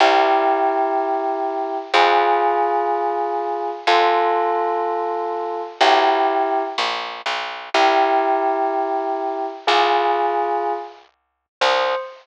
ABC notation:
X:1
M:6/8
L:1/16
Q:3/8=62
K:C
V:1 name="Tubular Bells"
[EG]12 | [F_A]12 | [FA]12 | [EG]6 z6 |
[EG]12 | [F_A]8 z4 | c6 z6 |]
V:2 name="Electric Bass (finger)" clef=bass
C,,12 | F,,12 | F,,12 | B,,,6 ^A,,,3 B,,,3 |
C,,12 | C,,12 | C,,6 z6 |]